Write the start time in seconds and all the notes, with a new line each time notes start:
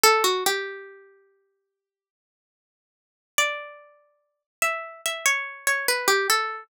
0.03 A4
0.24 F#4
0.46 G4
3.38 D5
4.62 E5
5.06 E5
5.26 C#5
5.67 C#5
5.88 B4
6.08 G4
6.30 A4